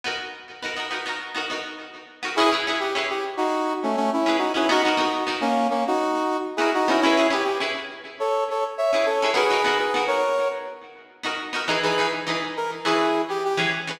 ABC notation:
X:1
M:4/4
L:1/16
Q:1/4=103
K:C#m
V:1 name="Brass Section"
z16 | [EG] z2 =G z G z [DF]3 [A,C] [A,C] [CE]2 [DF] [CE] | [DF] [DF]3 z [^A,C]2 [A,C] [DF]4 z [EG] [DF] [CE] | [CE]2 =G G z4 [Ac]2 [Ac] z [ce] [ce] [Ac]2 |
[GB]3 [GB]2 [^Ac]3 z8 | [K:E] z [GB]2 z3 ^A z [EG]3 =G G z3 |]
V:2 name="Pizzicato Strings"
[B,DF^A]4 [B,DFA] [B,DFA] [B,DFA] [B,DFA]2 [B,DFA] [B,DFA]5 [B,DFA] | [CEGB] [CEGB] [CEGB]2 [CEGB]9 [CEGB]2 [CEGB] | [B,DF^A] [B,DFA] [B,DFA]2 [B,DFA]9 [B,DFA]2 [B,DFA] | [CEGB] [CEGB] [CEGB]2 [CEGB]9 [CEGB]2 [CEGB] |
[B,DF^A] [B,DFA] [B,DFA]2 [B,DFA]9 [B,DFA]2 [B,DFA] | [K:E] [E,DGB] [E,DGB] [E,DGB]2 [E,DGB]4 [E,CGB]5 [E,CGB]2 [E,CGB] |]